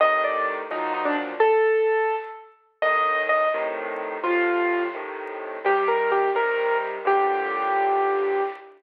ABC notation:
X:1
M:6/8
L:1/16
Q:3/8=85
K:Gm
V:1 name="Acoustic Grand Piano"
e2 d2 z2 E2 E D z2 | A8 z4 | e4 e2 z6 | F6 z6 |
G2 B2 G2 B4 z2 | G12 |]
V:2 name="Acoustic Grand Piano" clef=bass
[A,,C,E,]6 [E,,B,,F,_G,]6 | z12 | [C,,A,,E,]6 [A,,C,E,]6 | [A,,C,F,]6 [A,,C,E,]6 |
[C,E,G,]6 [C,E,G,]6 | [G,,A,,B,,D,]12 |]